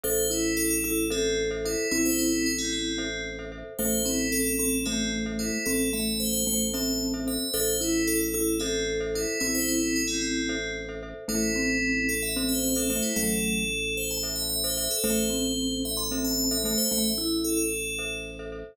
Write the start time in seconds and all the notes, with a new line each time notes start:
0.04 A1 A4 C5 E5
0.30 E4
0.57 A4
0.71 A4
0.84 E4 A4
1.10 C4 A4 C5 E5
1.51 A4 C5 E5
1.65 E4 A4 C5 E5
1.91 A1 C4 E4
2.05 C5
2.19 E4
2.46 E4
2.58 C4
2.73 C4
2.98 A4 C5 E5
3.39 A4 C5 E5
3.52 A4 C5 E5
3.79 A1 A3 A4 C5 E5
4.05 C4 E4
4.32 A4
4.47 A4
4.59 C4 A4
4.86 A3 C4 A4 C5 E5
5.26 A4 C5 E5
5.39 E4 A4 C5 E5
5.66 A1 C4 A4
5.93 A3 E5
6.20 C5
6.33 C5
6.47 A3 C5
6.74 C4 A4 C5 E5 A5
7.14 A4 C5 E5
7.27 A4 C5 E5
7.54 A1 A4 C5 E5
7.81 E4
8.07 A4
8.21 A4
8.34 E4 A4
8.60 C4 A4 C5 E5
9.00 A4 C5 E5
9.15 E4 A4 C5 E5
9.40 A1 C4 E4
9.55 C5
9.68 E4
9.96 E4
10.08 C4
10.21 C4
10.49 A4 C5 E5
10.89 A4 C5 E5
11.03 A4 C5 E5
11.28 A1 A3 E4 A4 C5 E5
11.56 C4
12.09 A4
12.23 E5
12.36 C4 A4 C5 E5
12.49 C5
12.63 C5
12.75 A4 C5 E5
12.90 A3 A4 C5 E5
13.03 E4
13.16 A1 F#3 A3 A4
13.97 C5
14.11 A5
14.23 A4 C5 E5
14.36 E5
14.49 E5
14.64 A4 C5 E5
14.77 A4 C5 E5
14.91 A4
15.04 A1 A3 A4 C5 E5
15.30 C4
15.85 E5
15.97 C6
16.11 C4 A4 C5 E5
16.25 A5
16.38 A5
16.51 A4 C5 E5
16.64 A3 A4 C5 E5 A5
16.78 C5
16.91 A1 A3 E5
17.04 E5
17.18 E4
17.44 A4
17.57 A4
17.99 A4 C5 E5
18.39 A4 C5 E5
18.52 A4 C5 E5